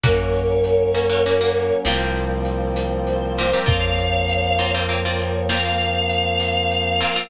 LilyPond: <<
  \new Staff \with { instrumentName = "Choir Aahs" } { \time 12/8 \key bes \minor \tempo 4. = 66 <bes' des''>2. r2 c''4 | <des'' f''>2 des''4 f''2. | }
  \new Staff \with { instrumentName = "Pizzicato Strings" } { \time 12/8 \key bes \minor <bes des' ges'>4. <bes des' ges'>16 <bes des' ges'>16 <bes des' ges'>16 <bes des' ges'>8. <bes c' f' g'>2~ <bes c' f' g'>8 <bes c' f' g'>16 <bes c' f' g'>16 | <bes c' f'>4. <bes c' f'>16 <bes c' f'>16 <bes c' f'>16 <bes c' f'>8. <bes c' f'>2~ <bes c' f'>8 <bes c' f'>16 <bes c' f'>16 | }
  \new Staff \with { instrumentName = "Synth Bass 2" } { \clef bass \time 12/8 \key bes \minor ges,2. c,2. | f,1. | }
  \new Staff \with { instrumentName = "Brass Section" } { \time 12/8 \key bes \minor <ges bes des'>2. <f g bes c'>2. | <f bes c'>1. | }
  \new DrumStaff \with { instrumentName = "Drums" } \drummode { \time 12/8 <hh bd>8 hh8 hh8 hh8 hh8 hh8 sn8 hh8 hh8 hh8 hh8 hh8 | <hh bd>8 hh8 hh8 hh8 hh8 hh8 sn8 hh8 hh8 hh8 hh8 hho8 | }
>>